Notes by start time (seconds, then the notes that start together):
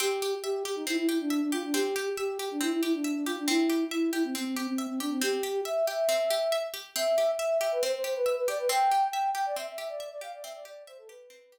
0.00 C4 G4
0.22 G4
0.43 G4 E5
0.65 G4
0.76 D#4
0.87 C4 E4
0.97 E4
1.08 E4 G4
1.20 D4
1.30 E5
1.41 D4
1.52 F4 G4
1.64 D4
1.73 C4 G4
1.96 G4
2.17 G4 E5
2.39 G4
2.51 D4
2.61 C4 E4
2.72 E4
2.82 E4 G4
2.94 D4
3.04 E5
3.15 D4
3.26 F4 G4
3.38 D4
3.48 C4 E4
3.69 G4
3.91 E4 E5
4.13 E4 G4
4.24 C4
4.35 C4
4.45 C4
4.56 C4 G4
4.67 C4
4.78 E5
4.89 C4
5.00 D4 G4
5.11 C4
5.21 C4 G4
5.43 G4
5.65 E5
5.87 G4 E5
6.09 C4
6.30 G4
6.52 E5
6.74 G4
6.96 C4 E5
7.18 G4
7.39 E5
7.61 G4 E5
7.72 B4
7.82 C4 C5
7.94 C5
8.04 G4 C5
8.15 B4
8.26 E5
8.37 B4
8.48 G4 D5
8.59 B4
8.69 C4 G5
8.91 G4
9.12 E5 G5
9.35 G4 G5
9.46 D5
9.56 C4 E5
9.67 E5
9.78 G4 E5
9.88 D5
10.00 E5
10.11 D5
10.21 G4 F5
10.33 D5
10.42 C4 E5
10.55 D5
10.65 G4 D5
10.87 C5 E5
10.98 A4
11.08 G4 B4
11.30 C4
11.52 G4